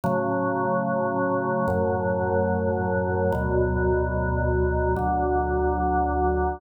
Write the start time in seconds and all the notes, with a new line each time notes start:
0.04 A2 C#3 F#3
1.68 F#2 A2 F#3
3.32 D2 B2 F#3
4.96 D2 D3 F#3